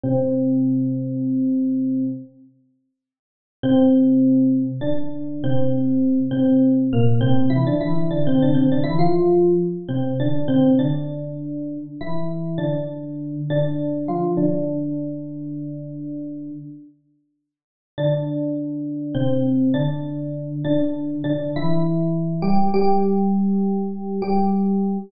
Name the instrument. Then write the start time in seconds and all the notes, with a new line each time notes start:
electric piano 1
0.04 C3 C4
3.63 C3 C4
4.81 D3 D4
5.44 C3 C4
6.31 C3 C4
6.93 A#2 A#3
7.21 C3 C4
7.50 E3 E4
7.67 D3 D4
7.81 E3 E4
8.11 D3 D4
8.27 C3 C4
8.42 D3 D4
8.55 C3 C4
8.72 D3 D4
8.84 E3 E4
8.99 F3 F4
9.89 C3 C4
10.20 D3 D4
10.48 C3 C4
10.79 D3 D4
12.01 E3 E4
12.58 D3 D4
13.50 D3 D4
14.08 F3 F4
14.37 D3 D4
17.98 D3 D4
19.15 C3 C4
19.74 D3 D4
20.65 D3 D4
21.24 D3 D4
21.56 E3 E4
22.42 G3 G4
22.74 G3 G4
24.22 G3 G4